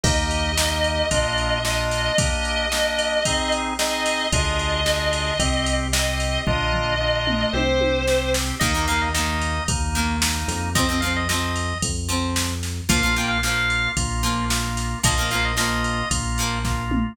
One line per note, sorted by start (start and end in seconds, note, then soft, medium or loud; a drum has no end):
0.03 1.03 D#2 loud
0.03 0.52 A#3 medium
0.03 0.52 D#4 medium
0.03 0.52 G4 loud
0.03 1.60 D#5 loud
0.03 kick loud
0.03 crash loud
0.31 ride medium
0.57 1.06 A#3 medium
0.57 1.06 D#4 medium
0.57 1.06 G4 medium
0.57 snare loud
0.84 ride medium
1.11 2.10 A#1 loud
1.11 1.59 A#3 medium
1.11 1.59 D4 medium
1.11 1.59 F4 loud
1.11 kick medium
1.11 ride medium
1.38 ride medium
1.64 2.12 A#3 medium
1.64 2.12 D4 medium
1.64 2.12 F4 medium
1.64 2.17 D#5 loud
1.64 snare medium
1.91 snare medium
1.91 ride medium
2.18 2.66 A#3 medium
2.18 2.66 D4 medium
2.18 2.66 G4 medium
2.18 3.53 D#5 loud
2.18 kick loud
2.18 ride loud
2.45 ride medium
2.71 3.20 A#3 medium
2.71 3.20 D4 medium
2.71 3.20 G4 medium
2.71 snare medium
2.99 ride medium
3.25 3.74 C4 medium
3.25 3.74 D#4 medium
3.25 3.74 G#4 medium
3.25 kick medium
3.25 ride loud
3.52 ride medium
3.79 4.27 C4 medium
3.79 4.27 D#4 medium
3.79 4.27 G#4 medium
3.79 4.26 D#5 loud
3.79 snare loud
4.06 snare medium
4.06 ride medium
4.32 5.31 D2 loud
4.32 4.81 D4 medium
4.32 4.81 F4 medium
4.32 4.81 G#4 medium
4.32 5.72 D#5 loud
4.32 kick medium
4.32 ride medium
4.59 ride medium
4.86 5.34 D4 medium
4.86 5.34 F4 medium
4.86 5.34 G#4 medium
4.86 snare medium
5.13 ride medium
5.39 6.38 C2 loud
5.39 5.88 C4 medium
5.39 5.88 G4 medium
5.39 kick medium
5.39 ride medium
5.66 ride medium
5.93 6.42 C4 medium
5.93 6.42 G4 medium
5.93 6.37 D#5 loud
5.93 snare loud
6.20 snare soft
6.20 ride medium
6.47 7.46 A#1 loud
6.47 6.95 A#3 medium
6.47 6.95 D4 loud
6.47 6.95 F4 loud
6.47 7.50 D#5 loud
6.47 kick medium
6.47 floor tom medium
6.74 floor tom medium
7.00 7.49 A#3 medium
7.00 7.49 D4 medium
7.00 7.49 F4 medium
7.27 mid tom medium
7.53 8.52 C2 loud
7.53 8.02 C4 medium
7.53 8.02 G4 medium
7.53 8.29 C5 loud
7.53 high tom medium
7.81 high tom medium
8.07 8.55 C4 medium
8.07 8.55 G4 medium
8.07 snare medium
8.34 snare loud
8.59 9.59 D#2 loud
8.59 8.71 D#3 medium
8.59 9.09 A#3 medium
8.59 8.71 A#3 medium
8.59 9.09 D#4 medium
8.59 8.86 D#5 medium
8.59 kick medium
8.59 crash medium
8.75 8.85 D#3 medium
8.75 8.85 A#3 medium
8.87 9.09 D#3 medium
8.87 9.09 A#3 medium
8.87 9.01 F5 medium
8.87 ride medium
9.01 9.13 D#5 medium
9.14 9.58 D#3 medium
9.14 9.63 A#3 medium
9.14 9.58 A#3 medium
9.14 9.63 D#4 medium
9.14 9.64 D#5 medium
9.14 snare medium
9.42 ride medium
9.68 10.45 D#2 medium
9.68 10.16 A#3 medium
9.68 10.16 D#4 medium
9.68 kick medium
9.68 ride medium
9.95 10.38 D#3 medium
9.95 10.38 A#3 medium
9.95 ride medium
10.21 10.70 A#3 medium
10.21 10.70 D#4 medium
10.21 snare loud
10.48 11.74 F2 loud
10.48 snare medium
10.48 ride medium
10.75 10.86 F3 medium
10.75 10.86 C4 medium
10.75 11.01 D#5 medium
10.75 kick medium
10.75 ride medium
10.89 10.99 F3 medium
10.89 10.99 C4 medium
11.01 11.24 F3 medium
11.01 11.24 C4 medium
11.01 11.13 F5 medium
11.01 ride medium
11.16 11.28 D#5 medium
11.28 11.73 F3 medium
11.28 11.73 C4 medium
11.28 11.78 D#5 medium
11.28 snare medium
11.56 ride medium
11.82 12.81 F2 medium
11.82 kick medium
11.82 ride medium
12.08 12.51 F3 medium
12.08 12.51 C4 medium
12.08 ride medium
12.36 snare loud
12.63 snare medium
12.63 ride medium
12.89 13.88 A#1 medium
12.89 13.00 F3 medium
12.89 13.38 A#3 medium
12.89 13.00 A#3 medium
12.89 13.38 F4 medium
12.89 13.15 F5 medium
12.89 kick medium
12.89 ride loud
13.03 13.14 F3 medium
13.03 13.14 A#3 medium
13.16 13.38 F3 medium
13.16 13.38 A#3 medium
13.16 13.30 G5 medium
13.16 ride medium
13.28 13.41 F5 medium
13.43 13.87 F3 medium
13.43 13.92 A#3 medium
13.43 13.87 A#3 medium
13.43 13.92 F4 medium
13.43 13.89 F5 medium
13.43 snare medium
13.70 ride medium
13.97 14.95 A#1 medium
13.97 14.45 A#3 medium
13.97 14.45 F4 medium
13.97 kick medium
13.97 ride medium
14.23 14.66 F3 medium
14.23 14.66 A#3 medium
14.23 ride medium
14.50 14.99 A#3 medium
14.50 14.99 F4 medium
14.50 snare loud
14.77 snare medium
14.77 ride medium
15.03 16.03 A#1 loud
15.03 15.14 F3 medium
15.03 15.52 A#3 medium
15.03 15.14 A#3 medium
15.03 15.52 F4 medium
15.03 15.30 D#5 medium
15.03 kick medium
15.03 ride loud
15.18 15.28 F3 medium
15.18 15.28 A#3 medium
15.31 15.53 F3 medium
15.31 15.53 A#3 medium
15.31 15.44 F5 medium
15.31 ride medium
15.45 15.57 D#5 medium
15.57 16.00 F3 medium
15.57 16.06 A#3 medium
15.57 16.00 A#3 medium
15.57 16.06 F4 medium
15.57 16.09 D#5 medium
15.57 snare loud
15.84 ride medium
16.11 17.09 A#1 medium
16.11 16.59 A#3 medium
16.11 16.59 F4 medium
16.11 kick medium
16.11 ride medium
16.38 16.82 F3 medium
16.38 16.82 A#3 medium
16.38 ride medium
16.65 17.13 A#3 medium
16.65 17.13 F4 medium
16.65 kick medium
16.65 snare medium
16.91 mid tom medium